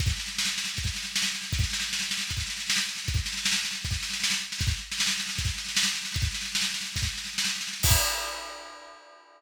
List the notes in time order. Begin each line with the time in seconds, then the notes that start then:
0.00 kick, snare
0.10 snare
0.20 snare
0.28 snare
0.38 snare
0.47 snare
0.58 snare
0.68 snare
0.77 kick, snare
0.87 snare
0.96 snare
1.05 snare
1.16 snare
1.25 snare
1.35 snare
1.44 snare
1.53 kick, snare
1.64 snare
1.73 snare
1.82 snare
1.93 snare
2.03 snare
2.11 snare
2.21 snare
2.30 kick, snare
2.40 snare
2.50 snare
2.60 snare
2.70 snare
2.79 snare
2.89 snare
2.98 snare
3.08 kick, snare
3.17 snare
3.26 snare
3.37 snare
3.46 snare
3.56 snare
3.65 snare
3.75 snare
3.85 kick, snare
3.94 snare
4.03 snare
4.13 snare
4.23 snare
4.33 snare
4.52 snare
4.61 kick, snare
4.71 snare
4.92 snare
5.00 snare
5.10 snare
5.20 snare
5.29 snare
5.38 kick, snare
5.47 snare
5.58 snare
5.68 snare
5.77 snare
5.87 snare
5.95 snare
6.05 snare
6.14 kick, snare
6.25 snare
6.34 snare
6.45 snare
6.55 snare
6.64 snare
6.74 snare
6.86 snare
6.96 kick, snare
7.06 snare
7.17 snare
7.27 snare
7.38 snare
7.49 snare
7.61 snare
7.73 snare
7.83 kick, crash